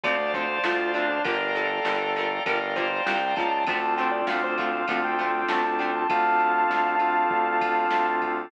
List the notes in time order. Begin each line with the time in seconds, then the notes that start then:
0.04 D2 D3 F3 A3 C4 C5 D5 F5 A5, kick, ride
0.34 D3 F3 A3 C4 C5, kick, ride
0.64 D2 D3 F3 A3 C4 F4, snare
0.94 D3 F3 A3 C4 D4, ride
1.09 D4
1.24 G1 D3 F3 G3 A#3 A#4 D5 F5 G5 A#5, kick, ride
1.55 D3 F3 G3 A#3 A4, ride
1.85 G1 D3 F3 G3 A#3, snare
2.16 D3 F3 G3 A#3, ride
2.46 G1 D3 F3 G3 A#3 A#4 D5 F5 G5 A#5, kick, ride
2.76 D3 F3 G3 A#3 C5, kick, ride
3.06 C2 D3 F3 G3 A#3 G5, snare
3.36 C#2 D3 F3 G3 A#3 A5, kick, ride
3.52 A5
3.67 D2 D3 F3 A3 C4 D4 F4 A4 A5, kick, ride
3.97 D3 F3 A3 C4 G5, ride
4.11 D5
4.27 D2 D3 F3 A3 C4 F5, snare, ride
4.44 C5
4.58 D3 F3 A3 C4 F5, kick, ride
4.88 D2 D3 F3 A3 C4 D4 F4 A4, kick, ride
5.04 G5
5.19 D3 F3 A3 C4, ride
5.48 D2 D3 F3 A3 C4 A5, snare
5.64 A5
5.79 D3 F3 A3 C4 G5, ride
5.96 A5
6.09 D2 C4 D4 F4 A4 F5 A5, kick, ride
6.40 ride
6.70 D2, snare
6.99 C4 D4 F4 A4, ride
7.30 D2, kick
7.61 kick, ride
7.91 D2, snare
8.22 kick, ride